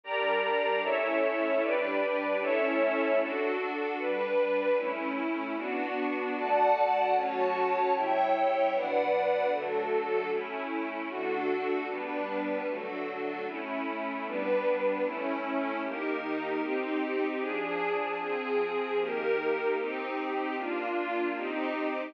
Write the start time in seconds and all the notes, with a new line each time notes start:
0.03 G3 D4 G4 A#4 D5 A#5
0.83 A3 C#4 E4 A4 C#5 E5
1.62 G3 D4 G4 B4 D5
2.41 A3 C#4 E4 A4 C#5 E5
3.20 D4 F#4 A4
3.99 G3 D4 B4
4.78 A3 C#4 E4
5.56 B3 D4 F#4
6.36 D3 A3 F#4 D5 F#5 A5
7.14 F#3 A3 C#4 F#4 C#5 A5
7.93 C#3 G3 E4 C#5 E5 G5
8.72 B2 F#3 D4 B4 D5 F#5
9.51 D3 F#3 A3 D4 F#4 A4
10.30 A3 C#4 E4
11.09 D3 A3 D4 F#4 A4
11.88 G3 B3 D4 B4
12.67 D3 F#3 A3 D4 F#4 A4
13.46 A3 C#4 E4
14.25 G3 B3 D4 B4
15.03 A3 C#4 E4
15.83 D#3 A#3 D#4 G4 A#4
16.62 C4 D#4 G4
17.41 F3 D4 G#4
18.20 F3 C4 G#4
18.99 D#3 A#3 D#4 G4 A#4
19.77 C4 D#4 G4
20.56 A#3 D4 F4
21.36 C4 D#4 G4